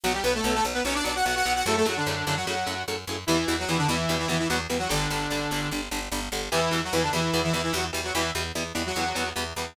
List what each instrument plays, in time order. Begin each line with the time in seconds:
0.03 electric bass (finger) B1, overdriven guitar B2 F#3, lead 2 (sawtooth) F#3 F#4
0.14 lead 2 (sawtooth) G3 G4
0.24 electric bass (finger) B1, overdriven guitar B2 F#3, lead 2 (sawtooth) B3 B4
0.35 lead 2 (sawtooth) A3 A4
0.44 electric bass (finger) B1, overdriven guitar B2 F#3
0.54 lead 2 (sawtooth) A3 A4
0.64 electric bass (finger) B1, overdriven guitar B2 F#3
0.74 lead 2 (sawtooth) B3 B4
0.85 electric bass (finger) B1, overdriven guitar B2 F#3, lead 2 (sawtooth) C#4 C#5
0.95 lead 2 (sawtooth) D4 D5
1.04 electric bass (finger) B1, overdriven guitar B2 F#3, lead 2 (sawtooth) D4 D5
1.15 lead 2 (sawtooth) F#4 F#5
1.25 electric bass (finger) B1, overdriven guitar B2 F#3, lead 2 (sawtooth) F#4 F#5
1.36 lead 2 (sawtooth) F#4 F#5
1.45 electric bass (finger) B1, overdriven guitar B2 F#3
1.55 lead 2 (sawtooth) F#4 F#5
1.66 electric bass (finger) F#2, overdriven guitar A2 C#3 F#3, lead 2 (sawtooth) A3 A4
1.76 lead 2 (sawtooth) A3 A4
1.85 electric bass (finger) F#2, overdriven guitar A2 C#3 F#3, lead 2 (sawtooth) F#3 F#4
1.96 lead 2 (sawtooth) D3 D4
2.06 electric bass (finger) F#2, overdriven guitar A2 C#3 F#3
2.26 electric bass (finger) F#2, overdriven guitar A2 C#3 F#3, lead 2 (sawtooth) D3 D4
2.36 lead 2 (sawtooth) F#3 F#4
2.47 electric bass (finger) F#2, overdriven guitar A2 C#3 F#3, lead 2 (sawtooth) F#3 F#4
2.66 electric bass (finger) F#2, overdriven guitar A2 C#3 F#3
2.88 electric bass (finger) F#2, overdriven guitar A2 C#3 F#3
3.07 electric bass (finger) F#2, overdriven guitar A2 C#3 F#3
3.27 electric bass (finger) E2, overdriven guitar B2 E3 G3, lead 2 (sawtooth) E3 E4
3.48 electric bass (finger) E2, overdriven guitar B2 E3 G3
3.59 lead 2 (sawtooth) F#3 F#4
3.68 electric bass (finger) E2, overdriven guitar B2 E3 G3, lead 2 (sawtooth) E3 E4
3.78 lead 2 (sawtooth) D3 D4
3.88 electric bass (finger) E2, overdriven guitar B2 E3 G3, lead 2 (sawtooth) E3 E4
4.09 electric bass (finger) E2, overdriven guitar B2 E3 G3
4.19 lead 2 (sawtooth) E3 E4
4.28 electric bass (finger) E2, overdriven guitar B2 E3 G3, lead 2 (sawtooth) E3 E4
4.39 lead 2 (sawtooth) E3 E4
4.49 electric bass (finger) E2, overdriven guitar B2 E3 G3, lead 2 (sawtooth) F#3 F#4
4.70 electric bass (finger) E2, overdriven guitar B2 E3 G3
4.79 lead 2 (sawtooth) F#3 F#4
4.89 electric bass (finger) G1, overdriven guitar D3 G3, lead 2 (sawtooth) D3 D4
5.10 electric bass (finger) G1, overdriven guitar D3 G3
5.30 electric bass (finger) G1, overdriven guitar D3 G3
5.51 electric bass (finger) G1, overdriven guitar D3 G3
5.71 electric bass (finger) G1, overdriven guitar D3 G3
5.91 electric bass (finger) G1, overdriven guitar D3 G3
6.12 electric bass (finger) G1, overdriven guitar D3 G3
6.32 electric bass (finger) G1, overdriven guitar D3 G3
6.52 electric bass (finger) E2, overdriven guitar B2 E3 G3, lead 2 (sawtooth) E3 E4
6.71 electric bass (finger) E2, overdriven guitar B2 E3 G3
6.84 lead 2 (sawtooth) F#3 F#4
6.93 electric bass (finger) E2, overdriven guitar B2 E3 G3, lead 2 (sawtooth) E3 E4
7.02 lead 2 (sawtooth) D3 D4
7.13 electric bass (finger) E2, overdriven guitar B2 E3 G3, lead 2 (sawtooth) E3 E4
7.33 electric bass (finger) E2, overdriven guitar B2 E3 G3
7.43 lead 2 (sawtooth) E3 E4
7.53 electric bass (finger) E2, overdriven guitar B2 E3 G3, lead 2 (sawtooth) E3 E4
7.63 lead 2 (sawtooth) E3 E4
7.73 electric bass (finger) E2, overdriven guitar B2 E3 G3, lead 2 (sawtooth) F#3 F#4
7.93 electric bass (finger) E2, overdriven guitar B2 E3 G3
8.04 lead 2 (sawtooth) F#3 F#4
8.15 electric bass (finger) E2, overdriven guitar B2 E3 G3, lead 2 (sawtooth) E3 E4
8.35 electric bass (finger) E2, overdriven guitar B2 E3 G3
8.55 electric bass (finger) E2, overdriven guitar B2 E3 G3
8.75 electric bass (finger) E2, overdriven guitar B2 E3 G3
8.86 lead 2 (sawtooth) F#3 F#4
8.96 electric bass (finger) E2, overdriven guitar B2 E3 G3
9.15 electric bass (finger) E2, overdriven guitar B2 E3 G3
9.36 electric bass (finger) E2, overdriven guitar B2 E3 G3
9.56 electric bass (finger) E2, overdriven guitar B2 E3 G3